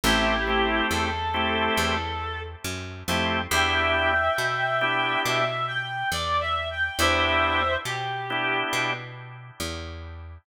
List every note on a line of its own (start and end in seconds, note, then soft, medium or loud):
0.04 0.82 A1 medium
0.04 0.34 A3 medium
0.04 0.34 C4 medium
0.04 0.34 E4 medium
0.04 0.85 E4 medium
0.04 0.34 G4 medium
0.04 0.85 G4 medium
0.47 1.08 A3 medium
0.47 1.08 C4 medium
0.47 1.08 E4 medium
0.47 1.08 G4 medium
0.90 1.69 E2 medium
0.90 2.40 A4 medium
1.34 1.95 A3 medium
1.34 1.95 C4 medium
1.34 1.95 E4 medium
1.34 1.95 G4 medium
1.77 2.56 E2 medium
2.64 3.03 F#2 medium
3.08 3.47 F2 medium
3.08 3.39 A3 medium
3.08 3.39 C4 medium
3.08 3.39 E4 medium
3.08 3.39 G4 medium
3.51 4.29 E2 medium
3.51 4.12 B3 medium
3.51 4.12 D4 medium
3.51 4.12 E4 medium
3.51 4.12 G4 medium
3.51 5.20 E5 medium
3.51 5.20 G5 medium
4.38 5.16 B2 medium
4.81 5.42 B3 medium
4.81 5.42 D4 medium
4.81 5.42 E4 medium
4.81 5.42 G4 medium
5.25 6.04 B2 medium
5.25 5.66 E5 medium
5.67 6.07 G5 medium
6.12 6.90 E2 medium
6.12 6.40 D5 medium
6.40 6.68 E5 medium
6.71 6.98 G5 medium
6.99 7.77 E2 medium
6.99 7.61 B3 medium
6.99 7.61 D4 medium
6.99 7.61 E4 medium
6.99 7.61 G4 medium
6.99 7.73 C5 medium
6.99 7.73 E5 medium
7.85 8.64 B2 medium
7.85 8.56 G4 medium
8.30 8.91 B3 medium
8.30 8.91 D4 medium
8.30 8.91 E4 medium
8.30 8.91 G4 medium
8.73 9.51 B2 medium
9.60 10.38 E2 medium